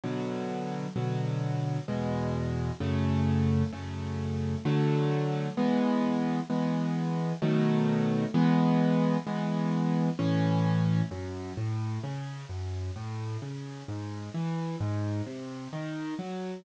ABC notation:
X:1
M:3/4
L:1/8
Q:1/4=65
K:A
V:1 name="Acoustic Grand Piano"
[B,,D,F,]2 [B,,D,F,]2 [E,,B,,G,]2 | [F,,C,A,]2 [F,,C,A,]2 [D,F,A,]2 | [E,G,B,]2 [E,G,B,]2 [B,,^D,F,A,]2 | [E,G,B,]2 [E,G,B,]2 [A,,E,C]2 |
[K:F#m] F,, A,, C, F,, A,, C, | G,, E, G,, ^B,, ^D, F, |]